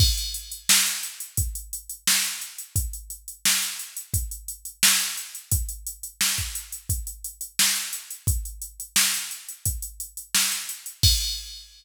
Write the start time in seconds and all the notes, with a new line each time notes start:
0.00 kick, crash
0.18 closed hi-hat
0.34 closed hi-hat
0.52 closed hi-hat
0.69 snare
0.86 closed hi-hat
1.03 closed hi-hat
1.20 closed hi-hat
1.37 kick, closed hi-hat
1.55 closed hi-hat
1.73 closed hi-hat
1.90 closed hi-hat
2.07 snare
2.24 closed hi-hat
2.41 closed hi-hat
2.58 closed hi-hat
2.76 kick, closed hi-hat
2.93 closed hi-hat
3.10 closed hi-hat
3.28 closed hi-hat
3.45 snare
3.62 closed hi-hat
3.79 closed hi-hat
3.97 closed hi-hat
4.14 kick, closed hi-hat
4.31 closed hi-hat
4.48 closed hi-hat
4.65 closed hi-hat
4.83 snare
5.00 closed hi-hat
5.17 closed hi-hat
5.35 closed hi-hat
5.52 kick, closed hi-hat
5.69 closed hi-hat
5.86 closed hi-hat
6.03 closed hi-hat
6.21 snare
6.38 kick, closed hi-hat
6.55 closed hi-hat
6.72 closed hi-hat
6.89 kick, closed hi-hat
7.07 closed hi-hat
7.24 closed hi-hat
7.41 closed hi-hat
7.59 snare
7.76 closed hi-hat
7.93 closed hi-hat
8.10 closed hi-hat
8.27 kick, closed hi-hat
8.45 closed hi-hat
8.62 closed hi-hat
8.80 closed hi-hat
8.96 snare
9.14 closed hi-hat
9.31 closed hi-hat
9.49 closed hi-hat
9.66 kick, closed hi-hat
9.82 closed hi-hat
10.00 closed hi-hat
10.17 closed hi-hat
10.34 snare
10.52 closed hi-hat
10.69 closed hi-hat
10.86 closed hi-hat
11.03 kick, crash